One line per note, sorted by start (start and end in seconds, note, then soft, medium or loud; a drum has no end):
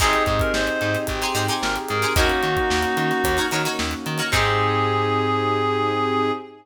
0.00 0.15 G#1 loud
0.00 2.14 C4 medium
0.00 2.13 C4 medium
0.00 2.14 D#4 medium
0.00 1.04 D#4 loud
0.00 0.43 D#4 loud
0.00 2.13 D#4 medium
0.00 2.14 G4 medium
0.00 2.13 G4 medium
0.00 0.43 G4 loud
0.00 2.14 G#4 medium
0.00 2.13 G#4 medium
0.00 0.23 G#4 loud
0.00 0.43 G#4 loud
0.00 0.43 C5 loud
0.00 kick loud
0.00 crash loud
0.13 closed hi-hat medium
0.26 0.42 G#2 loud
0.26 0.40 G#4 medium
0.26 kick loud
0.26 closed hi-hat medium
0.39 0.52 A#4 medium
0.39 kick loud
0.39 closed hi-hat medium
0.54 0.69 G#1 loud
0.54 0.98 C5 medium
0.54 snare loud
0.67 closed hi-hat medium
0.81 0.96 G#2 loud
0.81 closed hi-hat medium
0.94 snare medium
0.94 closed hi-hat medium
1.07 1.23 G#1 loud
1.07 1.34 G4 loud
1.07 kick medium
1.07 closed hi-hat loud
1.22 1.32 D#4 medium
1.22 1.32 G4 loud
1.22 1.32 G#4 loud
1.22 1.32 C5 loud
1.22 snare soft
1.22 closed hi-hat medium
1.35 1.50 G#2 loud
1.35 1.45 D#4 loud
1.35 1.45 G4 loud
1.35 1.79 G4 loud
1.35 1.45 G#4 medium
1.35 1.45 C5 loud
1.35 closed hi-hat medium
1.48 1.92 D#4 loud
1.48 1.92 G4 loud
1.48 1.92 G#4 medium
1.48 1.92 C5 loud
1.48 closed hi-hat medium
1.62 1.77 G#1 loud
1.62 1.75 A#4 medium
1.62 snare loud
1.76 closed hi-hat medium
1.89 2.05 G#2 loud
1.89 2.13 G#4 medium
1.89 2.13 A#4 loud
1.89 closed hi-hat loud
2.02 2.13 D#4 loud
2.02 2.13 G4 medium
2.02 2.13 G#4 loud
2.02 2.13 C5 loud
2.02 closed hi-hat medium
2.16 2.31 D#2 loud
2.16 4.28 A#3 medium
2.16 4.30 A#3 medium
2.16 4.28 C#4 medium
2.16 4.30 C#4 medium
2.16 4.28 D#4 medium
2.16 2.59 D#4 loud
2.16 3.47 D#4 medium
2.16 4.30 D#4 medium
2.16 4.28 F#4 medium
2.16 3.37 F#4 loud
2.16 3.47 F#4 medium
2.16 4.30 F#4 medium
2.16 2.59 F#4 loud
2.16 2.59 A#4 loud
2.16 2.59 C#5 loud
2.16 kick loud
2.16 closed hi-hat loud
2.30 closed hi-hat medium
2.43 2.58 D#3 loud
2.43 closed hi-hat medium
2.57 kick loud
2.57 closed hi-hat medium
2.70 2.85 D#2 loud
2.70 snare loud
2.83 closed hi-hat medium
2.97 3.12 D#3 medium
2.97 closed hi-hat loud
3.11 snare medium
3.11 closed hi-hat medium
3.24 3.39 D#2 loud
3.24 kick loud
3.24 closed hi-hat loud
3.37 3.48 D#4 loud
3.37 3.48 F#4 loud
3.37 3.48 A#4 loud
3.37 3.48 C#5 medium
3.37 closed hi-hat medium
3.51 3.67 D#3 medium
3.51 3.63 D#4 loud
3.51 3.63 F#4 medium
3.51 3.63 A#4 loud
3.51 3.63 C#5 loud
3.51 closed hi-hat medium
3.65 4.08 D#4 loud
3.65 4.08 F#4 loud
3.65 4.08 A#4 loud
3.65 4.08 C#5 loud
3.65 closed hi-hat medium
3.79 3.94 D#2 loud
3.79 snare loud
3.91 closed hi-hat medium
4.06 4.21 D#3 loud
4.06 closed hi-hat loud
4.18 4.29 D#4 loud
4.18 4.29 F#4 loud
4.18 4.29 A#4 loud
4.18 4.29 C#5 medium
4.18 closed hi-hat medium
4.32 6.32 G#2 loud
4.32 6.31 C4 loud
4.32 6.31 D#4 medium
4.32 6.31 D#4 loud
4.32 6.32 D#4 loud
4.32 6.31 G4 loud
4.32 6.32 G4 loud
4.32 6.31 G#4 loud
4.32 6.32 G#4 loud
4.32 6.32 C5 loud
4.32 kick loud
4.32 crash loud